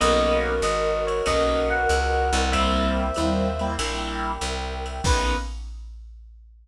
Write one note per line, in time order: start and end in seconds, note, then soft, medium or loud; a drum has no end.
0.00 0.61 B1 loud
0.00 0.52 A#3 loud
0.00 0.52 B3 loud
0.00 0.52 C#4 loud
0.00 0.52 D#4 loud
0.00 2.39 F#4 medium
0.00 1.26 A#4 loud
0.00 2.39 A#4 medium
0.00 1.26 B4 medium
0.00 1.26 C#5 medium
0.00 1.26 D#5 loud
0.00 0.38 D#5 loud
0.00 ride loud
0.62 1.22 G#1 loud
0.62 1.03 D#5 medium
0.62 hi-hat pedal medium
0.62 ride medium
1.07 1.25 C#5 medium
1.07 ride medium
1.26 1.86 B1 medium
1.26 1.78 A#3 medium
1.26 1.78 B3 medium
1.26 1.78 C#4 medium
1.26 1.78 D#4 loud
1.26 2.52 A#4 medium
1.26 2.52 B4 loud
1.26 2.52 D#5 loud
1.26 1.67 D#5 medium
1.26 2.52 F#5 loud
1.26 kick medium
1.26 ride loud
1.70 2.50 F#5 medium
1.89 2.31 C#2 loud
1.89 hi-hat pedal medium
1.89 ride medium
2.33 3.11 C2 loud
2.33 ride medium
2.51 3.05 G3 loud
2.51 3.05 A#3 loud
2.51 3.05 C4 loud
2.51 3.05 E4 loud
2.51 3.78 G4 medium
2.51 3.78 A#4 loud
2.51 3.71 C5 medium
2.51 3.79 C5 medium
2.51 3.67 E5 loud
2.51 3.71 E5 medium
2.51 3.78 E5 medium
2.51 kick medium
2.51 ride loud
3.14 3.77 D#2 medium
3.14 3.48 G3 loud
3.14 3.48 A#3 loud
3.14 3.48 C4 medium
3.14 3.48 E4 medium
3.14 hi-hat pedal medium
3.14 ride medium
3.59 3.74 G3 medium
3.59 3.74 A#3 medium
3.59 3.74 C4 loud
3.59 3.74 E4 loud
3.59 ride medium
3.79 4.38 A#1 loud
3.79 4.31 G3 medium
3.79 4.31 A#3 loud
3.79 4.31 C4 medium
3.79 4.31 E4 loud
3.79 5.04 G4 loud
3.79 5.04 A#4 loud
3.79 5.04 E5 loud
3.79 5.04 G5 loud
3.79 ride loud
4.41 5.01 C2 loud
4.41 hi-hat pedal medium
4.41 ride medium
4.86 ride medium
5.04 5.35 B1 loud
5.04 5.35 A#3 medium
5.04 5.37 A#3 loud
5.04 5.35 B3 loud
5.04 5.37 B3 loud
5.04 5.35 C#4 loud
5.04 5.37 C#4 medium
5.04 5.35 D#4 loud
5.04 5.37 D#4 loud
5.04 5.36 B4 loud
5.04 5.37 B4 loud
5.04 kick loud
5.04 crash loud